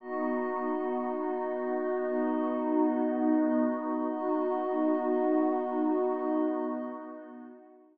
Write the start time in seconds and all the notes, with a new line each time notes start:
0.00 B3 D#4 F#4 D#5
2.05 B3 D#4 D#5
4.08 B3 D#4 F#4 D#5
6.12 B3 D#4 D#5